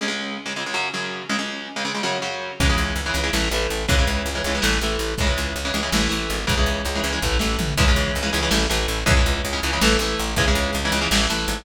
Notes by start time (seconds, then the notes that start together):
0.01 C#2 C#3 G#3
0.08 C#2 C#3 G#3
0.46 C#2 C#3 G#3
0.56 C#2 C#3 G#3
0.66 C#2 C#3 G#3
0.74 F#2 C#3 F#3
0.94 F#2 C#3 F#3
1.29 C#2 C#3 G#3
1.39 C#2 C#3 G#3
1.76 C#2 C#3 G#3
1.85 C#2 C#3 G#3
1.94 C#2 C#3 G#3
2.03 F#2 C#3 F#3
2.22 F#2 C#3 F#3
2.60 C#2 C#3 E3 G#3, kick, crash
2.70 C#3 E3 G#3
2.77 C#2, closed hi-hat
2.96 C#2, closed hi-hat
3.06 C#3 E3 G#3
3.14 C#2 C#3 E3 G#3, closed hi-hat
3.24 C#3 E3 G#3
3.33 A1 E3 A3, snare
3.51 A1 E3 A3, closed hi-hat
3.69 A1, closed hi-hat
3.88 C#2 C#3 E3 G#3, kick, closed hi-hat
3.98 C#3 E3 G#3
4.07 C#2, closed hi-hat
4.26 C#2, closed hi-hat
4.35 C#3 E3 G#3
4.44 C#2 C#3 E3 G#3, closed hi-hat
4.55 C#3 E3 G#3
4.62 A1 E3 A3, snare
4.81 A1 E3 A3, closed hi-hat
4.99 A1, closed hi-hat
5.18 C#2 C#3 E3 G#3, kick, closed hi-hat
5.27 C#3 E3 G#3
5.37 C#2, closed hi-hat
5.56 C#2, closed hi-hat
5.65 C#3 E3 G#3
5.73 C#2 C#3 E3 G#3, closed hi-hat
5.83 C#3 E3 G#3
5.92 A1 E3 A3, snare
6.09 A1 E3 A3, closed hi-hat
6.29 G#1, closed hi-hat
6.47 C#2 C#3 E3 G#3, kick, closed hi-hat
6.57 C#3 E3 G#3
6.66 C#2, closed hi-hat
6.85 C#2, closed hi-hat
6.95 C#3 E3 G#3
7.03 C#2 C#3 E3 G#3, closed hi-hat
7.12 C#3 E3 G#3
7.22 A1 E3 A3, kick
7.39 A1 E3 A3, snare
7.59 A1, floor tom
7.77 C#2 C#3 E3 G#3, kick, crash
7.88 C#3 E3 G#3
7.96 C#2, closed hi-hat
8.15 C#2, closed hi-hat
8.23 C#3 E3 G#3
8.33 C#2 C#3 E3 G#3, closed hi-hat
8.42 C#3 E3 G#3
8.51 A1 E3 A3, snare
8.69 A1 E3 A3, closed hi-hat
8.88 A1, closed hi-hat
9.06 C#2 C#3 E3 G#3, kick, closed hi-hat
9.17 C#3 E3 G#3
9.26 C#2, closed hi-hat
9.45 C#2, closed hi-hat
9.53 C#3 E3 G#3
9.62 C#2 C#3 E3 G#3, closed hi-hat
9.73 C#3 E3 G#3
9.81 A1 E3 A3, snare
9.99 A1 E3 A3, closed hi-hat
10.18 A1, closed hi-hat
10.36 C#2 C#3 E3 G#3, kick, closed hi-hat
10.48 C#3 E3 G#3
10.54 C#2, closed hi-hat
10.73 C#2, closed hi-hat
10.85 C#3 E3 G#3
10.91 C#2 C#3 E3 G#3, closed hi-hat
11.01 C#3 E3 G#3
11.11 A1 E3 A3, snare
11.30 A1 E3 A3, closed hi-hat
11.48 G#1, closed hi-hat